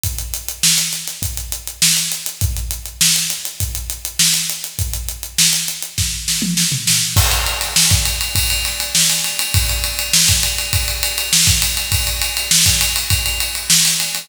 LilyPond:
\new DrumStaff \drummode { \time 4/4 \tempo 4 = 101 <hh bd>16 hh16 hh16 hh16 sn16 <hh sn>16 <hh sn>16 <hh sn>16 <hh bd>16 hh16 hh16 hh16 sn16 hh16 hh16 hh16 | <hh bd>16 hh16 hh16 hh16 sn16 hh16 <hh sn>16 hh16 <hh bd>16 hh16 hh16 hh16 sn16 hh16 hh16 hh16 | <hh bd>16 hh16 hh16 hh16 sn16 hh16 hh16 hh16 <bd sn>8 sn16 toml16 sn16 tomfh16 sn8 | <cymc bd>16 cymr16 cymr16 <cymr sn>16 sn16 <bd cymr>16 cymr16 cymr16 <bd cymr>16 cymr16 <cymr sn>16 cymr16 sn16 cymr16 cymr16 cymr16 |
<bd cymr>16 cymr16 cymr16 cymr16 sn16 <bd cymr sn>16 cymr16 cymr16 <bd cymr>16 cymr16 cymr16 cymr16 sn16 <bd cymr>16 cymr16 <cymr sn>16 | <bd cymr>16 cymr16 cymr16 cymr16 sn16 <bd cymr>16 cymr16 cymr16 <bd cymr>16 cymr16 cymr16 cymr16 sn16 cymr16 <cymr sn>16 <cymr sn>16 | }